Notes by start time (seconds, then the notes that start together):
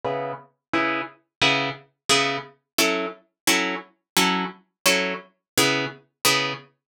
0.05 C#3 B3 E4 G#4
0.73 C#3 B3 E4 G#4
1.42 C#3 B3 E4 G#4
2.09 C#3 B3 E4 G#4
2.78 F#3 C#4 E4 A4
3.47 F#3 C#4 E4 A4
4.17 F#3 C#4 E4 A4
4.86 F#3 C#4 E4 A4
5.58 C#3 B3 E4 G#4
6.25 C#3 B3 E4 G#4